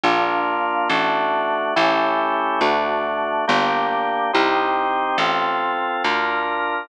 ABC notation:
X:1
M:4/4
L:1/8
Q:1/4=70
K:Gm
V:1 name="Drawbar Organ"
[B,DF]2 [A,D^F]2 [A,^C=EG]2 [A,DF]2 | [B,DG]2 [CEG]2 [CFA]2 [DFB]2 |]
V:2 name="Electric Bass (finger)" clef=bass
B,,,2 A,,,2 A,,,2 D,,2 | G,,,2 C,,2 A,,,2 D,,2 |]